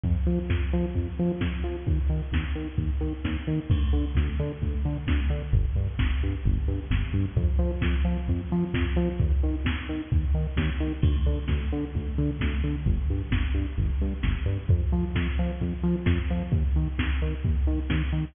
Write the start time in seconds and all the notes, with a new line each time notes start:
0.03 F2, kick, closed hi-hat
0.16 closed hi-hat
0.27 F3, open hi-hat
0.38 closed hi-hat
0.50 F2, kick, snare
0.61 closed hi-hat
0.73 F3, open hi-hat
0.85 closed hi-hat
0.95 F2, kick, closed hi-hat
1.07 closed hi-hat
1.17 F3, open hi-hat
1.30 closed hi-hat
1.41 F2, kick, snare
1.53 closed hi-hat
1.63 F3, open hi-hat
1.76 closed hi-hat
1.87 D#2, kick, closed hi-hat
1.99 closed hi-hat
2.09 D#3, open hi-hat
2.21 closed hi-hat
2.32 D#2, kick, snare
2.43 closed hi-hat
2.55 D#3, open hi-hat
2.68 closed hi-hat
2.78 D#2, kick, closed hi-hat
2.89 closed hi-hat
3.01 D#3, open hi-hat
3.13 closed hi-hat
3.24 D#2, kick, snare
3.47 D#3, open hi-hat
3.58 closed hi-hat
3.70 D2, kick, crash
3.81 closed hi-hat
3.92 D3, open hi-hat
4.04 closed hi-hat
4.15 D2, kick, snare
4.27 closed hi-hat
4.39 D3, open hi-hat
4.51 closed hi-hat
4.62 D2, kick, closed hi-hat
4.73 closed hi-hat
4.85 D3, open hi-hat
4.96 closed hi-hat
5.07 D2, kick, snare
5.19 closed hi-hat
5.30 D3, open hi-hat
5.42 closed hi-hat
5.52 G1, kick, closed hi-hat
5.65 closed hi-hat
5.76 G2, open hi-hat
5.88 closed hi-hat
5.99 G1, kick, snare
6.10 closed hi-hat
6.21 G2, open hi-hat
6.34 closed hi-hat
6.45 G1, kick, closed hi-hat
6.57 closed hi-hat
6.68 G2, open hi-hat
6.79 closed hi-hat
6.91 G1, kick, snare
7.02 closed hi-hat
7.13 G2, open hi-hat
7.25 closed hi-hat
7.36 F2, kick, closed hi-hat
7.48 closed hi-hat
7.59 F3, open hi-hat
7.71 closed hi-hat
7.81 F2, kick, snare
7.95 closed hi-hat
8.05 F3, open hi-hat
8.16 closed hi-hat
8.28 F2, kick, closed hi-hat
8.39 closed hi-hat
8.51 F3, open hi-hat
8.62 closed hi-hat
8.74 F2, kick, snare
8.86 closed hi-hat
8.96 F3, open hi-hat
9.07 closed hi-hat
9.20 D#2, kick, closed hi-hat
9.32 closed hi-hat
9.43 D#3, open hi-hat
9.55 closed hi-hat
9.65 D#2, kick, snare
9.77 closed hi-hat
9.88 D#3, open hi-hat
10.00 closed hi-hat
10.11 D#2, kick, closed hi-hat
10.22 closed hi-hat
10.34 D#3, open hi-hat
10.46 closed hi-hat
10.57 D#2, kick, snare
10.69 closed hi-hat
10.80 D#3, open hi-hat
10.92 closed hi-hat
11.02 D2, kick, crash
11.15 closed hi-hat
11.26 D3, open hi-hat
11.37 closed hi-hat
11.48 D2, kick, snare
11.60 closed hi-hat
11.71 D3, open hi-hat
11.82 closed hi-hat
11.93 D2, kick, closed hi-hat
12.06 closed hi-hat
12.18 D3, open hi-hat
12.28 closed hi-hat
12.40 D2, kick, snare
12.52 closed hi-hat
12.64 D3, open hi-hat
12.75 closed hi-hat
12.86 G1, kick, closed hi-hat
12.97 closed hi-hat
13.10 G2, open hi-hat
13.21 closed hi-hat
13.31 G1, kick, snare
13.43 closed hi-hat
13.54 G2, open hi-hat
13.67 closed hi-hat
13.78 G1, kick, closed hi-hat
13.89 closed hi-hat
14.00 G2, open hi-hat
14.12 closed hi-hat
14.23 G1, kick, snare
14.36 closed hi-hat
14.46 G2, open hi-hat
14.58 closed hi-hat
14.69 F2, kick, closed hi-hat
14.80 closed hi-hat
14.92 F3, open hi-hat
15.03 closed hi-hat
15.15 F2, kick, snare
15.26 closed hi-hat
15.38 F3, open hi-hat
15.49 closed hi-hat
15.60 F2, kick, closed hi-hat
15.73 closed hi-hat
15.83 F3, open hi-hat
15.96 closed hi-hat
16.06 F2, kick, snare
16.17 closed hi-hat
16.29 F3, open hi-hat
16.41 closed hi-hat
16.51 D#2, kick, closed hi-hat
16.64 closed hi-hat
16.76 D#3, open hi-hat
16.86 closed hi-hat
16.98 D#2, kick, snare
17.11 closed hi-hat
17.21 D#3, open hi-hat
17.32 closed hi-hat
17.44 D#2, kick, closed hi-hat
17.55 closed hi-hat
17.66 D#3, open hi-hat
17.79 closed hi-hat
17.90 D#2, kick, snare
18.01 closed hi-hat
18.12 D#3, open hi-hat
18.24 closed hi-hat